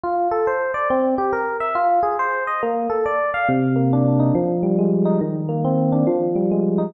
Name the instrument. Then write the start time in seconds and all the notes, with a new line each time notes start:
electric piano 1
0.04 F4
0.31 A4
0.47 C5
0.74 D5
0.90 C4
1.18 G4
1.33 A#4
1.60 E5
1.75 F4
2.03 G#4
2.19 C5
2.47 D#5
2.63 A#3
2.90 A4
3.06 D5
3.34 F5
3.48 C3
3.76 A#3
3.93 D4
4.20 D#4
4.35 F3
4.63 G3
4.79 G#3
5.05 D#4
5.21 D#3
5.49 A#3
5.64 C4
5.92 D4
6.07 F3
6.36 G3
6.51 G#3
6.78 D#4